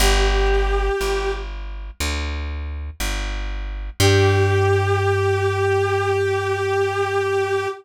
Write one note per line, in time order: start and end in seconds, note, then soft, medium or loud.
0.00 0.90 G1 loud
0.00 1.32 G4 medium
1.01 1.91 G1 medium
2.00 2.90 D2 medium
3.00 3.90 G1 medium
4.00 7.67 G2 loud
4.00 7.67 G4 loud